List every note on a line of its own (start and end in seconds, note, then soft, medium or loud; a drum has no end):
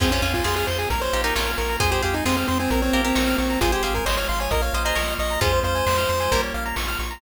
0.00 0.19 F2 loud
0.00 0.89 C4 medium
0.00 0.12 C4 loud
0.00 0.11 C#4 loud
0.00 0.11 F4 loud
0.00 0.89 F4 medium
0.00 0.10 G#4 medium
0.00 0.89 G#4 medium
0.00 kick loud
0.00 crash loud
0.11 0.22 C#4 loud
0.11 0.22 C#4 medium
0.11 0.22 F4 medium
0.11 0.21 C5 medium
0.11 closed hi-hat medium
0.22 0.41 F2 medium
0.22 0.43 C#4 medium
0.22 0.33 C#4 medium
0.22 0.43 F4 medium
0.22 0.33 F5 medium
0.22 closed hi-hat medium
0.34 0.45 F4 medium
0.34 0.44 G#5 medium
0.34 kick medium
0.34 closed hi-hat medium
0.44 0.64 F2 medium
0.44 0.84 F4 medium
0.44 0.84 G#4 medium
0.44 0.55 G#4 medium
0.44 0.55 C6 medium
0.44 snare loud
0.56 0.67 G#4 loud
0.56 0.67 F6 medium
0.56 closed hi-hat medium
0.67 0.87 F2 medium
0.67 0.78 C5 medium
0.67 0.78 C6 medium
0.67 closed hi-hat medium
0.78 0.89 G#4 medium
0.78 0.89 G#5 medium
0.78 closed hi-hat medium
0.90 1.09 A#1 loud
0.90 1.79 A#3 medium
0.90 1.79 C#4 medium
0.90 1.79 F4 medium
0.90 1.00 A#4 medium
0.90 1.02 A#4 medium
0.90 kick medium
0.90 closed hi-hat loud
1.01 1.22 C5 loud
1.01 1.11 C#5 medium
1.01 closed hi-hat medium
1.13 1.33 A#1 medium
1.13 1.23 D#4 medium
1.13 1.23 G4 medium
1.13 1.23 F5 medium
1.13 closed hi-hat medium
1.24 1.35 D#4 medium
1.24 1.35 G4 loud
1.24 1.51 A#4 medium
1.24 1.34 A#5 medium
1.24 closed hi-hat medium
1.35 1.55 A#1 medium
1.35 1.77 C#4 medium
1.35 1.77 F4 medium
1.35 1.46 C#6 medium
1.35 snare loud
1.47 1.57 F6 medium
1.47 closed hi-hat medium
1.57 1.77 A#1 medium
1.57 1.77 A#4 medium
1.57 1.68 C#6 medium
1.57 closed hi-hat medium
1.69 1.79 A#5 medium
1.69 closed hi-hat medium
1.80 2.00 F2 medium
1.80 2.70 G#3 medium
1.80 2.70 C4 medium
1.80 2.70 F4 medium
1.80 1.91 G#4 loud
1.80 1.91 C5 loud
1.80 kick loud
1.80 closed hi-hat loud
1.91 2.02 G4 medium
1.91 2.02 G#4 medium
1.91 2.02 C5 medium
1.91 closed hi-hat medium
2.02 2.23 F2 medium
2.02 2.15 G4 medium
2.02 2.22 G#4 medium
2.02 2.22 C5 medium
2.02 2.13 F5 medium
2.02 closed hi-hat medium
2.14 2.25 D#4 medium
2.14 2.24 G#5 medium
2.14 closed hi-hat medium
2.25 2.45 F2 medium
2.25 2.36 C4 loud
2.25 2.66 F4 medium
2.25 2.66 G#4 medium
2.25 2.36 C6 medium
2.25 snare loud
2.37 2.47 C4 medium
2.37 2.47 F6 medium
2.37 closed hi-hat medium
2.47 2.68 F2 medium
2.47 2.58 C4 medium
2.47 2.58 C6 medium
2.47 closed hi-hat medium
2.59 2.70 C4 loud
2.59 2.69 G#5 medium
2.59 closed hi-hat medium
2.70 2.90 A#1 medium
2.70 3.60 A#3 medium
2.70 2.82 C4 loud
2.70 3.60 C#4 medium
2.70 3.60 F4 medium
2.70 2.81 A#4 medium
2.70 kick medium
2.70 closed hi-hat loud
2.82 3.02 C4 loud
2.82 2.92 C#5 medium
2.82 closed hi-hat medium
2.93 3.13 A#1 medium
2.93 3.04 G4 medium
2.93 3.04 A#4 loud
2.93 3.03 F5 medium
2.93 closed hi-hat medium
3.04 3.37 C4 loud
3.04 3.15 G4 medium
3.04 3.15 A#4 medium
3.04 3.15 A#5 medium
3.04 closed hi-hat medium
3.15 3.35 A#1 medium
3.15 3.58 A#4 medium
3.15 3.58 C#5 medium
3.15 3.26 C#6 medium
3.15 snare loud
3.27 3.37 F6 medium
3.27 closed hi-hat medium
3.38 3.57 A#1 medium
3.38 3.60 C4 medium
3.38 3.48 C#6 medium
3.38 closed hi-hat medium
3.50 3.60 A#5 medium
3.50 closed hi-hat medium
3.61 3.80 G#1 medium
3.61 4.06 G#3 medium
3.61 4.06 C4 medium
3.61 3.72 F4 loud
3.61 4.06 F4 medium
3.61 3.71 G#4 medium
3.61 3.72 G#4 medium
3.61 3.72 C5 loud
3.61 kick loud
3.61 closed hi-hat loud
3.72 3.83 G4 loud
3.72 3.82 G#4 medium
3.72 3.82 C5 medium
3.72 closed hi-hat medium
3.83 4.03 G#1 medium
3.83 3.94 G4 medium
3.83 4.04 G#4 medium
3.83 4.04 C5 medium
3.83 3.94 F5 medium
3.83 closed hi-hat medium
3.94 4.05 A#4 medium
3.94 4.05 G#5 medium
3.94 kick medium
3.94 closed hi-hat medium
4.06 4.25 G#1 medium
4.06 4.51 F3 medium
4.06 4.51 G#3 medium
4.06 4.51 F4 medium
4.06 4.46 C5 medium
4.06 4.16 C#5 medium
4.06 4.46 D#5 medium
4.06 4.16 C6 medium
4.06 snare loud
4.17 4.28 C#5 medium
4.17 4.27 F6 medium
4.17 closed hi-hat medium
4.28 4.48 G#1 medium
4.28 4.40 F5 medium
4.28 4.39 C6 medium
4.28 closed hi-hat medium
4.40 4.51 C#5 medium
4.40 4.50 G#5 medium
4.40 closed hi-hat medium
4.51 4.70 A#1 medium
4.51 4.96 A#3 medium
4.51 4.96 C#4 medium
4.51 4.96 F4 medium
4.51 4.62 A#4 loud
4.51 4.62 D#5 loud
4.51 kick medium
4.51 closed hi-hat loud
4.62 4.73 C#5 medium
4.62 4.83 F5 medium
4.62 closed hi-hat medium
4.73 4.93 A#1 medium
4.73 4.85 C5 medium
4.73 4.85 D#5 medium
4.73 4.84 F5 medium
4.73 closed hi-hat medium
4.84 4.96 G#4 medium
4.84 4.96 C5 loud
4.84 5.14 D#5 medium
4.84 4.95 A#5 medium
4.84 closed hi-hat medium
4.95 5.15 A#1 medium
4.95 5.41 F3 medium
4.95 5.41 A#3 medium
4.95 5.41 F4 medium
4.95 5.37 A#4 medium
4.95 5.37 C#5 medium
4.95 5.06 C#6 medium
4.95 snare loud
5.08 5.18 F6 medium
5.08 closed hi-hat medium
5.19 5.38 A#1 medium
5.19 5.40 D#5 loud
5.19 5.29 C#6 medium
5.19 closed hi-hat medium
5.30 5.40 A#5 medium
5.30 closed hi-hat medium
5.41 5.61 F2 loud
5.41 5.86 G#3 medium
5.41 5.86 C4 medium
5.41 6.22 C#4 loud
5.41 6.22 F4 loud
5.41 5.86 F4 medium
5.41 5.52 G#4 medium
5.41 5.60 C5 loud
5.41 kick loud
5.41 closed hi-hat loud
5.53 5.63 C5 medium
5.53 closed hi-hat medium
5.63 5.83 F2 medium
5.63 6.42 C5 loud
5.63 5.74 F5 medium
5.63 closed hi-hat medium
5.75 5.85 G#5 medium
5.75 closed hi-hat medium
5.86 6.06 F2 medium
5.86 6.31 F3 medium
5.86 6.31 G#3 medium
5.86 6.31 F4 medium
5.86 5.97 C6 medium
5.86 snare loud
5.98 6.08 F6 medium
5.98 closed hi-hat medium
6.09 6.28 F2 medium
6.09 6.19 C6 medium
6.09 closed hi-hat medium
6.20 6.30 G#5 medium
6.20 closed hi-hat medium
6.31 6.51 A#1 medium
6.31 6.93 G3 medium
6.31 6.76 A#3 medium
6.31 6.93 A#3 medium
6.31 6.76 C#4 medium
6.31 6.76 F4 medium
6.31 6.42 A#4 medium
6.31 kick medium
6.31 closed hi-hat loud
6.43 6.53 C#5 medium
6.43 closed hi-hat medium
6.54 6.73 A#1 medium
6.54 6.64 F5 medium
6.54 closed hi-hat medium
6.66 6.76 A#5 medium
6.66 closed hi-hat medium
6.76 6.96 A#1 medium
6.76 7.21 F3 medium
6.76 7.21 A#3 medium
6.76 7.21 F4 medium
6.76 6.87 C#6 medium
6.76 snare loud
6.88 6.98 F6 medium
6.88 closed hi-hat medium
6.99 7.18 A#1 medium
6.99 7.10 C#6 medium
6.99 closed hi-hat medium
7.11 7.21 A#5 medium
7.11 closed hi-hat medium